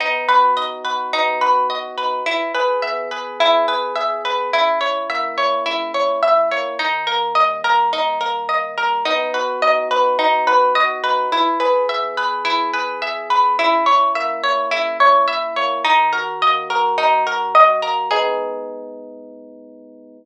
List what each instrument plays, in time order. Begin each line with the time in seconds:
0.00 electric piano 1 B3, harpsichord D#4
0.28 electric piano 1 F#4, harpsichord B4
0.57 electric piano 1 D#4, harpsichord D#5
0.85 electric piano 1 F#4, harpsichord B4
1.13 electric piano 1 B3, harpsichord D#4
1.41 electric piano 1 F#4, harpsichord B4
1.70 electric piano 1 F#4, harpsichord D#5
1.98 electric piano 1 D#4, harpsichord B4
2.26 electric piano 1 E3, harpsichord E4
2.54 electric piano 1 G#4, harpsichord B4
2.82 electric piano 1 B3, harpsichord E5
3.11 electric piano 1 G#4, harpsichord B4
3.40 electric piano 1 E3, harpsichord E4
3.68 electric piano 1 G#4, harpsichord B4
3.96 electric piano 1 G#4, harpsichord E5
4.25 electric piano 1 B3, harpsichord B4
4.53 electric piano 1 C#3, harpsichord E4
4.81 electric piano 1 E4, harpsichord C#5
5.09 electric piano 1 A#3, harpsichord E5
5.38 electric piano 1 E4, harpsichord C#5
5.66 electric piano 1 C#3, harpsichord E4
5.94 electric piano 1 E4, harpsichord C#5
6.23 electric piano 1 E4, harpsichord E5
6.51 electric piano 1 A#3, harpsichord C#5
6.79 electric piano 1 D#3, harpsichord D#4
7.07 electric piano 1 A#3, harpsichord A#4
7.35 electric piano 1 G3, harpsichord D#5
7.64 electric piano 1 A#3, harpsichord A#4
7.92 electric piano 1 D#3, harpsichord D#4
8.21 electric piano 1 A#3, harpsichord A#4
8.49 electric piano 1 A#3, harpsichord D#5
8.77 electric piano 1 G3, harpsichord A#4
9.05 electric piano 1 B3, harpsichord D#4
9.34 electric piano 1 F#4, harpsichord B4
9.62 electric piano 1 D#4, harpsichord D#5
9.91 electric piano 1 F#4, harpsichord B4
10.19 electric piano 1 B3, harpsichord D#4
10.47 electric piano 1 F#4, harpsichord B4
10.75 electric piano 1 F#4, harpsichord D#5
11.04 electric piano 1 D#4, harpsichord B4
11.32 electric piano 1 E3, harpsichord E4
11.60 electric piano 1 G#4, harpsichord B4
11.89 electric piano 1 B3, harpsichord E5
12.17 electric piano 1 G#4, harpsichord B4
12.45 electric piano 1 E3, harpsichord E4
12.73 electric piano 1 G#4, harpsichord B4
13.02 electric piano 1 G#4, harpsichord E5
13.30 electric piano 1 B3, harpsichord B4
13.58 electric piano 1 C#3, harpsichord E4
13.86 electric piano 1 E4, harpsichord C#5
14.15 electric piano 1 A#3, harpsichord E5
14.43 electric piano 1 E4, harpsichord C#5
14.71 electric piano 1 C#3, harpsichord E4
15.00 electric piano 1 E4, harpsichord C#5
15.28 electric piano 1 E4, harpsichord E5
15.56 electric piano 1 A#3, harpsichord C#5
15.84 electric piano 1 D#3, harpsichord D#4
16.13 electric piano 1 F#4, harpsichord A#4
16.42 electric piano 1 A#3, harpsichord D#5
16.70 electric piano 1 F#4, harpsichord A#4
16.98 electric piano 1 D#3, harpsichord D#4
17.26 electric piano 1 F#4, harpsichord A#4
17.55 electric piano 1 F#4, harpsichord D#5
17.82 electric piano 1 A#3, harpsichord A#4
18.11 electric piano 1 G#3 B3 D#4, harpsichord G#4